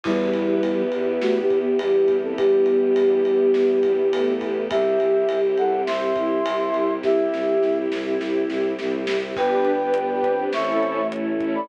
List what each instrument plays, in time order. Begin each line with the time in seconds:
0.03 violin E2, flute G3 E4, string ensemble 1 B3 E4 G4, choir aahs B3, kick, crash
0.33 violin E2, ride
0.62 violin E2, ride
0.92 violin E2, ride
1.21 violin E2, flute A3 F#4, snare
1.40 flute B3 G4
1.50 violin E2, kick, ride
1.60 flute B3 G4
1.78 violin E2, choir aahs G3, flute B3 G4, ride
2.08 violin E2, kick, ride
2.23 flute C4 A4
2.38 violin E2, choir aahs G3, flute B3 G4, kick, ride
2.66 violin E2, ride
2.96 violin E2, ride
3.25 violin E2, ride
3.54 violin E2, snare
3.83 violin E2, kick, ride
4.12 violin E2, choir aahs A3, ride
4.41 violin E2, kick, ride
4.70 violin C2, string ensemble 1 C4 E4 G4, flute G4 E5, choir aahs G4, kick, ride
4.99 violin C2, ride
5.29 violin C2, ride
5.57 violin C2, flute A4 F#5, ride
5.87 violin C2, choir aahs C4, flute E5 C6, snare
6.16 violin C2, choir aahs E4, kick, ride
6.45 violin C2, ride
6.73 violin C2, ride
7.02 violin C2, choir aahs E4, flute G4 E5, kick, snare
7.33 violin C2, snare
7.61 violin C2, snare
7.92 violin C2, snare
8.20 violin C2, snare
8.49 violin C2, snare
8.79 violin C2, snare
9.07 violin C2, snare
9.35 violin G1, choir aahs B3, string ensemble 1 B3 D4 G4 B4, flute B4 G5, kick, crash
9.65 closed hi-hat
9.80 string ensemble 1 D4 G4 B4
9.94 closed hi-hat
10.09 string ensemble 1 D4 G4 B4
10.23 choir aahs C4, kick, closed hi-hat
10.39 string ensemble 1 D4 G4 B4
10.53 violin A1, string ensemble 1 A3 C#4 E4 A4, flute E5 C#6, snare
10.83 closed hi-hat
11.12 choir aahs E4, closed hi-hat
11.40 string ensemble 1 C#4 E4 A4, kick, closed hi-hat
11.55 flute D5 B5